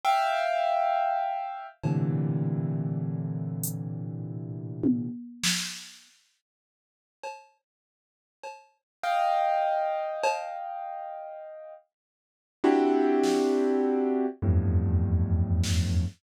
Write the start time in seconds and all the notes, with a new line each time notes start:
0.04 E5 F5 G5
1.83 A2 A#2 C3 D3 E3, cowbell
3.64 closed hi-hat
4.83 high tom
5.44 snare
7.24 cowbell
8.44 cowbell
9.04 D#5 F5 G5
10.23 cowbell
12.64 C4 D4 E4 F#4 G4
13.23 snare
14.42 E2 F2 G2 A2
15.63 snare